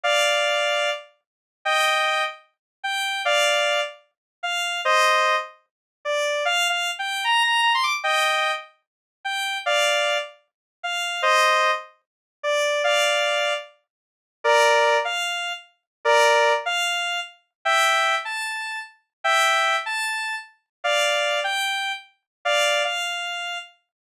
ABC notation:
X:1
M:4/4
L:1/16
Q:1/4=150
K:Gm
V:1 name="Lead 1 (square)"
[df]10 z6 | [eg]6 z6 g4 | [df]6 z6 f4 | [ce]6 z6 d4 |
(3f4 f4 g4 b2 b2 b c' d' z | [eg]6 z6 g4 | [df]6 z6 f4 | [ce]6 z6 d4 |
[df]8 z8 | [K:Dm] [Bd]6 f6 z4 | [Bd]6 f6 z4 | [eg]6 a6 z4 |
[eg]6 a6 z4 | [df]6 g6 z4 | [df]4 f8 z4 |]